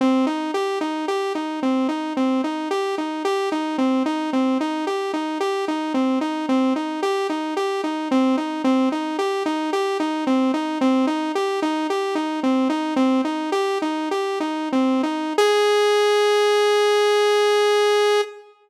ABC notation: X:1
M:4/4
L:1/8
Q:1/4=111
K:Abmix
V:1 name="Lead 2 (sawtooth)"
C E =G E G E C E | C E =G E G E C E | C E =G E G E C E | C E =G E G E C E |
C E =G E G E C E | C E =G E G E C E | "^rit." C E =G E G E C E | A8 |]